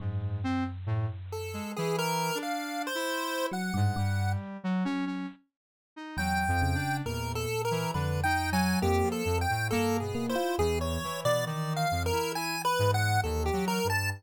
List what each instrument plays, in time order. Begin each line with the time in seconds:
0.00 electric piano 1 F#2, lead 1 (square) G#2
0.44 lead 1 (square) C4
0.86 lead 1 (square) A2
1.32 lead 1 (square) A4
1.53 lead 1 (square) G#3
1.76 lead 1 (square) E3 G#4
1.99 lead 1 (square) A#4
2.35 lead 1 (square) D4
2.43 lead 1 (square) F5
2.87 lead 1 (square) C5
2.95 lead 1 (square) E4
3.51 electric piano 1 F#3, lead 1 (square) F#5
3.74 electric piano 1 G2, lead 1 (square) G#2
3.96 electric piano 1 G2, lead 1 (square) G3
4.64 lead 1 (square) F#3
4.85 electric piano 1 F#3, lead 1 (square) C#4
5.06 lead 1 (square) C#4
5.96 lead 1 (square) D#4
6.17 electric piano 1 E2, lead 1 (square) F#3 G5
6.48 lead 1 (square) F2
6.62 electric piano 1 C#3
6.75 lead 1 (square) D4
7.06 lead 1 (square) E2 A#4, electric piano 1 A#2
7.35 lead 1 (square) A4
7.65 lead 1 (square) A#4
7.71 lead 1 (square) E3
7.94 electric piano 1 F2, lead 1 (square) D3 B4
8.24 lead 1 (square) D#4 G5
8.52 lead 1 (square) F#3 G#5
8.82 lead 1 (square) F2 G4, electric piano 1 A#3
9.03 lead 1 (square) F3
9.12 lead 1 (square) A4
9.25 lead 1 (square) F2, electric piano 1 F2
9.41 lead 1 (square) G5
9.50 lead 1 (square) A2
9.71 electric piano 1 G2, lead 1 (square) A#3 A4
10.00 lead 1 (square) B2 G#4
10.15 electric piano 1 A#3
10.28 lead 1 (square) E4 C5
10.35 electric piano 1 F4
10.58 lead 1 (square) E2 G#4, electric piano 1 E3
10.81 lead 1 (square) C#5
11.04 lead 1 (square) E3
11.24 lead 1 (square) B2 D5
11.46 lead 1 (square) D#3 D5
11.76 lead 1 (square) F5
11.91 lead 1 (square) F2
12.06 lead 1 (square) A#4
12.13 lead 1 (square) E4
12.35 lead 1 (square) E4 G#5
12.65 lead 1 (square) B4
12.79 lead 1 (square) G#2
12.94 lead 1 (square) F#5
13.24 lead 1 (square) D#2 A4
13.46 lead 1 (square) G4
13.53 lead 1 (square) F#3
13.68 lead 1 (square) A#4
13.84 lead 1 (square) G2
13.90 lead 1 (square) A5